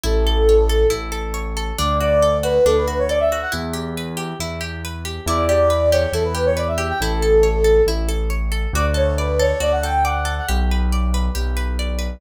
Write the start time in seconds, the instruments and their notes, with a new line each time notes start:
0.04 acoustic grand piano A1, orchestral harp E4, flute A4
0.27 orchestral harp A4
0.49 orchestral harp C#5
0.69 orchestral harp A4
0.90 acoustic grand piano A1, orchestral harp E4
1.12 orchestral harp A4
1.34 orchestral harp C#5
1.57 orchestral harp A4
1.78 acoustic grand piano D2, orchestral harp D4, flute D5
2.00 orchestral harp F#4, flute D5
2.22 orchestral harp A4
2.43 orchestral harp F#4, flute B4
2.65 acoustic grand piano D2, orchestral harp D4, flute A4
2.77 flute B4
2.88 orchestral harp F#4
2.98 flute C#5
3.09 orchestral harp A4, flute D5
3.20 flute E5
3.32 orchestral harp F#4
3.42 flute F#5
3.52 acoustic grand piano E2, orchestral harp E4
3.73 orchestral harp G4
3.97 orchestral harp B4
4.17 orchestral harp G4
4.40 acoustic grand piano E2, orchestral harp E4
4.61 orchestral harp G4
4.85 orchestral harp B4
5.05 orchestral harp G4
5.26 acoustic grand piano E2, orchestral harp E4, flute D5
5.48 orchestral harp G4, flute D5
5.70 orchestral harp B4
5.92 orchestral harp G4, flute C#5
6.12 acoustic grand piano E2, orchestral harp E4, flute A4
6.24 flute B4
6.35 orchestral harp G4
6.46 flute C#5
6.57 orchestral harp B4, flute D5
6.68 flute E5
6.78 orchestral harp G4
6.89 flute G5
7.00 acoustic grand piano A1, orchestral harp E4, flute A4
7.22 orchestral harp A4
7.43 orchestral harp C#5
7.64 orchestral harp A4
7.87 acoustic grand piano A1, orchestral harp E4
8.09 orchestral harp A4
8.30 orchestral harp C#5
8.52 orchestral harp A4
8.73 acoustic grand piano D2, orchestral harp F#4, flute D5
8.94 orchestral harp A4, flute C#5
9.18 flute B4, orchestral harp D5
9.39 orchestral harp A4, flute C#5
9.60 acoustic grand piano D2, orchestral harp F#4, flute D5
9.72 flute F#5
9.83 orchestral harp A4, flute G5
10.04 orchestral harp D5, flute F#5
10.25 orchestral harp A4
10.38 flute F#5
10.49 acoustic grand piano B1, orchestral harp G4
10.71 orchestral harp B4
10.92 orchestral harp D5
11.14 orchestral harp B4
11.35 acoustic grand piano B1, orchestral harp G4
11.57 orchestral harp B4
11.79 orchestral harp D5
11.99 orchestral harp B4